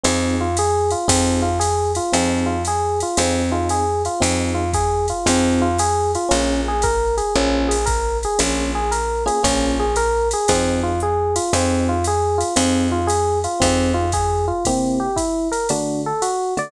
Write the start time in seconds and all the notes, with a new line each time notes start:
0.03 F2 C4 D#4 F4 G#4, ride
0.41 F4
0.57 G#4, hi-hat pedal, ride
0.90 F4, ride
1.08 F2 C4 D#4 F4 G#4, kick, ride
1.42 F4
1.60 G#4, hi-hat pedal, ride
1.95 F4, ride
2.12 F2 C4 D#4 F4 G#4, ride
2.46 F4
2.65 G#4, hi-hat pedal, ride
3.00 F4, ride
3.17 F2 C4 D#4 F4 G#4, ride
3.52 C4 D#4 F4 G#4
3.69 G#4, hi-hat pedal, ride
4.05 F4, ride
4.20 F2 C4 D#4 F4 G#4, ride
4.54 F4
4.73 G#4, kick, hi-hat pedal, ride
5.08 F4, ride
5.26 F2 C4 D#4 F4 G#4, ride
5.62 F4
5.78 G#4, hi-hat pedal, ride
6.15 F4, ride
6.29 A#1 A#3 C#4 F4 G#4, ride
6.68 G#4
6.82 A#4, kick, hi-hat pedal, ride
7.17 G#4, ride
7.35 A#1 A#3 C#4 F4 G#4
7.68 G#4, ride
7.86 A#4, kick, hi-hat pedal, ride
8.23 G#4, ride
8.39 A#1 A#3 C#4 F4 G#4, ride
8.75 G#4
8.91 A#4, hi-hat pedal, ride
9.26 A#3 C#4 F4 G#4, ride
9.43 A#1 A#3 C#4 F4 G#4, kick, ride
9.80 G#4
9.96 A#4, hi-hat pedal, ride
10.31 G#4, ride
10.48 F2 C4 D#4 F4 G#4, kick, ride
10.83 F4
11.00 G#4, hi-hat pedal
11.36 F4, ride
11.53 F2 C4 D#4 F4 G#4, ride
11.89 F4
12.04 G#4, hi-hat pedal, ride
12.38 F4, ride
12.56 F2 C4 D#4 F4 G#4, ride
12.92 F4
13.07 G#4, hi-hat pedal, ride
13.44 F4, ride
13.60 F2 C4 D#4 F4 G#4, kick, ride
13.94 F4
14.12 G#4, kick, hi-hat pedal, ride
14.48 F4
14.65 C3 A#3 C4 E4 G4, kick, ride
15.00 G4
15.16 E4, kick, hi-hat pedal, ride
15.52 A#4, ride
15.69 D3 A3 D4 F#4, ride
16.06 A4
16.22 F#4, hi-hat pedal, ride
16.57 D3 A3 F#4 D5, ride